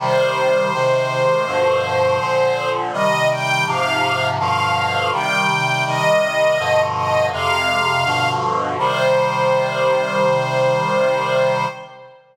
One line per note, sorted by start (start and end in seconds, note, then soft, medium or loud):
0.00 0.72 C3 loud
0.00 0.72 D#3 medium
0.00 0.72 G3 medium
0.00 2.69 C5 loud
0.73 1.46 C3 medium
0.73 1.46 D#3 medium
0.73 1.46 G#3 medium
1.46 2.19 G2 medium
1.46 2.19 B2 medium
1.46 2.19 D3 medium
1.46 2.19 F3 medium
2.20 2.92 A#2 medium
2.20 2.92 D3 medium
2.20 2.92 F3 medium
2.93 3.65 C3 medium
2.93 3.65 D#3 medium
2.93 3.65 G3 medium
2.93 3.28 D#5 loud
3.29 3.64 G5 medium
3.66 4.38 G#2 medium
3.66 4.38 C3 loud
3.66 4.38 F3 medium
3.66 4.27 F5 medium
4.38 5.12 G2 medium
4.38 5.12 B2 medium
4.38 5.12 D3 medium
4.38 5.12 F3 medium
4.38 5.09 F5 medium
5.12 5.85 C3 medium
5.12 5.85 D#3 medium
5.12 5.85 G3 medium
5.12 5.83 G5 medium
5.85 6.58 C3 medium
5.85 6.58 D#3 medium
5.85 6.58 G3 medium
5.85 6.82 D#5 loud
6.58 7.31 G2 medium
6.58 7.31 B2 medium
6.58 7.31 D3 loud
6.58 7.31 F3 medium
6.95 7.26 D#5 loud
7.32 8.04 F2 medium
7.32 8.04 C3 loud
7.32 8.04 G#3 medium
7.32 8.29 F5 loud
8.05 8.77 G2 medium
8.05 8.77 B2 loud
8.05 8.77 D3 medium
8.05 8.77 F3 medium
8.78 11.65 C3 loud
8.78 11.65 D#3 medium
8.78 11.65 G3 loud
8.78 11.65 C5 loud